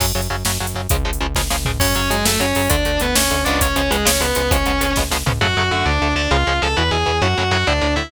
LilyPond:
<<
  \new Staff \with { instrumentName = "Distortion Guitar" } { \time 6/8 \key fis \minor \tempo 4. = 133 r2. | r2. | <cis' cis''>8 <cis' cis''>8 <gis gis'>8 <a a'>8 <cis' cis''>4 | <d' d''>4 <b b'>8 <cis' cis''>4 <d' d''>8 |
<cis' cis''>8 <cis' cis''>8 <gis gis'>8 <cis' cis''>8 <b b'>4 | <cis' cis''>4. r4. | <fis' fis''>4 <fis' fis''>8 <d' d''>4 <d' d''>8 | <eis' eis''>4 <a' a''>8 <b' b''>8 <gis' gis''>4 |
<fis' fis''>4 <fis' fis''>8 <d' d''>4 <e' e''>8 | }
  \new Staff \with { instrumentName = "Overdriven Guitar" } { \time 6/8 \key fis \minor <cis fis>8 <cis fis>8 <cis fis>8 <cis fis>8 <cis fis>8 <cis fis>8 | <cis eis gis>8 <cis eis gis>8 <cis eis gis>8 <cis eis gis>8 <cis eis gis>8 <cis eis gis>8 | <cis fis>8 <cis fis>8 <cis fis>8 <cis fis>8 <cis fis>8 <cis fis>8 | <d a>8 <d a>8 <d a>8 <d a>8 <d a>8 <cis eis gis b>8~ |
<cis eis gis b>8 <cis eis gis b>8 <cis eis gis b>8 <cis eis gis b>8 <cis eis gis b>8 <cis eis gis b>8 | <cis eis gis b>8 <cis eis gis b>8 <cis eis gis b>8 <cis eis gis b>8 <cis eis gis b>8 <cis eis gis b>8 | <cis fis a>8 <cis fis a>8 <d a>4 <d a>8 <d a>8 | <cis eis gis>8 <cis eis gis>8 <cis eis gis>8 <b, e>8 <b, e>8 <b, e>8 |
<a, cis fis>8 <a, cis fis>8 <a, cis fis>8 <a, d>8 <a, d>8 <a, d>8 | }
  \new Staff \with { instrumentName = "Synth Bass 1" } { \clef bass \time 6/8 \key fis \minor fis,8 fis,8 fis,8 fis,8 fis,8 fis,8 | cis,8 cis,8 cis,8 cis,8 cis,8 cis,8 | fis,8 fis,8 fis,8 fis,8 fis,8 fis,8 | d,8 d,8 d,8 d,8 d,8 cis,8~ |
cis,8 cis,8 cis,8 cis,8 cis,8 cis,8 | cis,8 cis,8 cis,8 cis,8 cis,8 cis,8 | fis,8 fis,8 fis,8 d,8 d,8 d,8 | cis,8 cis,8 cis,8 e,8 e,8 e,8 |
fis,8 fis,8 fis,8 d,8 d,8 d,8 | }
  \new DrumStaff \with { instrumentName = "Drums" } \drummode { \time 6/8 <cymc bd>8. hh8. sn8. hh8. | <hh bd>8. hh8. <bd sn>8 sn8 tomfh8 | <cymc bd>8 hh8 hh8 sn8 hh8 hho8 | <hh bd>8 hh8 hh8 sn8 hh8 hh8 |
<hh bd>8 hh8 hh8 sn8 hh8 hh8 | <hh bd>8 hh8 hh8 <bd sn>8 sn8 tomfh8 | r4. r4. | r4. r4. |
r4. r4. | }
>>